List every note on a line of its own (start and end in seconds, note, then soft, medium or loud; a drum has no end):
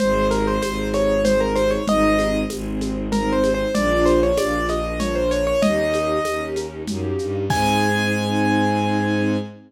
0.00 0.58 G#1 loud
0.00 0.56 C4 medium
0.00 0.56 D#4 loud
0.00 0.56 G#4 loud
0.00 0.27 C5 medium
0.00 low conga loud
0.00 shaker medium
0.31 0.46 A#4 medium
0.31 high conga medium
0.31 shaker medium
0.47 0.62 C5 medium
0.62 1.77 G#1 medium
0.62 1.19 C4 medium
0.62 1.19 D#4 medium
0.62 1.19 G#4 medium
0.62 0.89 C5 medium
0.62 tambourine medium
0.62 high conga loud
0.62 shaker loud
0.94 1.22 C#5 medium
0.94 high conga medium
0.94 shaker medium
1.25 1.81 C4 medium
1.25 1.81 D#4 medium
1.25 1.81 G#4 medium
1.25 1.39 C5 medium
1.25 low conga loud
1.25 shaker loud
1.40 1.55 A#4 medium
1.56 1.70 C5 medium
1.56 high conga medium
1.56 shaker medium
1.71 1.86 C#5 medium
1.87 2.45 G#1 medium
1.87 2.43 C4 loud
1.87 2.43 D#4 loud
1.87 2.43 G#4 loud
1.87 2.40 D#5 medium
1.87 low conga loud
1.87 shaker medium
2.19 high conga medium
2.19 shaker medium
2.49 3.65 G#1 medium
2.49 3.07 C4 medium
2.49 3.07 D#4 medium
2.49 3.07 G#4 medium
2.49 tambourine loud
2.49 high conga medium
2.49 shaker medium
2.81 high conga medium
2.81 shaker medium
3.12 3.69 C4 medium
3.12 3.69 D#4 medium
3.12 3.69 G#4 medium
3.12 3.32 A#4 medium
3.12 low conga loud
3.12 shaker medium
3.33 3.52 C5 medium
3.44 high conga loud
3.44 shaker medium
3.54 3.74 C5 medium
3.74 4.32 A#1 loud
3.74 4.32 A#3 loud
3.74 4.32 D4 loud
3.74 4.32 F4 loud
3.74 4.04 D5 medium
3.74 low conga loud
3.74 shaker loud
4.05 4.20 C5 medium
4.05 high conga medium
4.05 shaker medium
4.23 4.38 C#5 medium
4.37 5.52 A#1 medium
4.37 4.94 A#3 medium
4.37 4.94 D4 medium
4.37 4.94 F4 medium
4.37 4.66 D5 medium
4.37 tambourine loud
4.37 high conga loud
4.37 shaker loud
4.69 4.99 D#5 medium
4.69 high conga medium
4.69 shaker medium
4.99 5.55 A#3 medium
4.99 5.55 D4 medium
4.99 5.55 F4 medium
4.99 5.15 C#5 medium
4.99 low conga loud
4.99 shaker loud
5.15 5.30 C5 medium
5.31 5.46 C#5 medium
5.31 shaker medium
5.47 5.62 C#5 medium
5.62 6.20 D#2 medium
5.62 6.19 A#3 loud
5.62 6.19 C#4 loud
5.62 6.19 D#4 loud
5.62 6.19 G4 loud
5.62 6.44 D#5 medium
5.62 low conga loud
5.62 shaker medium
5.94 high conga medium
5.94 shaker medium
6.25 6.85 D#2 medium
6.25 6.83 A#3 medium
6.25 6.83 C#4 medium
6.25 6.83 D#4 medium
6.25 6.83 G4 medium
6.25 tambourine medium
6.25 high conga loud
6.25 shaker medium
6.56 high conga medium
6.56 shaker medium
6.86 7.14 F#2 medium
6.86 7.44 A#3 medium
6.86 7.44 C#4 medium
6.86 7.44 D#4 medium
6.86 7.44 G4 medium
6.86 low conga loud
6.86 shaker loud
7.19 7.48 G2 medium
7.19 shaker medium
7.50 9.37 G#2 loud
7.50 9.36 C4 loud
7.50 9.36 D#4 medium
7.50 9.36 G#4 loud
7.50 9.37 G#5 loud
7.50 kick loud
7.50 crash loud